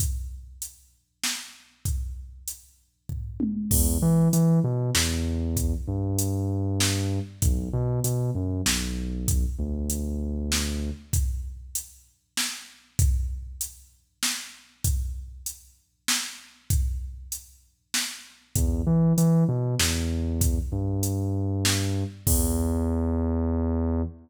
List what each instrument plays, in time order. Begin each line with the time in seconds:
0.00 kick, closed hi-hat
0.62 closed hi-hat
1.24 snare
1.85 kick, closed hi-hat
2.48 closed hi-hat
3.09 kick, floor tom
3.40 high tom
3.71 synth bass 2 E2, kick, crash
4.02 synth bass 2 E3
4.33 synth bass 2 E3, closed hi-hat
4.64 synth bass 2 B2
4.95 synth bass 2 E2, snare
5.57 kick, closed hi-hat
5.88 synth bass 2 G2
6.19 closed hi-hat
6.80 snare
7.42 synth bass 2 B1, kick, closed hi-hat
7.73 synth bass 2 B2
8.04 synth bass 2 B2, closed hi-hat
8.35 synth bass 2 F#2
8.66 synth bass 2 B1, snare
9.28 kick, closed hi-hat
9.59 synth bass 2 D2
9.90 closed hi-hat
10.52 snare
11.13 kick, closed hi-hat
11.75 closed hi-hat
12.37 snare
12.99 kick, closed hi-hat
13.61 closed hi-hat
14.23 snare
14.84 kick, closed hi-hat
15.46 closed hi-hat
16.08 snare
16.70 kick, closed hi-hat
17.32 closed hi-hat
17.94 snare
18.56 synth bass 2 E2, kick, closed hi-hat
18.87 synth bass 2 E3
19.18 synth bass 2 E3, closed hi-hat
19.48 synth bass 2 B2
19.79 synth bass 2 E2, snare
20.41 kick, closed hi-hat
20.72 synth bass 2 G2
21.03 closed hi-hat
21.65 snare
22.27 synth bass 2 E2, kick, crash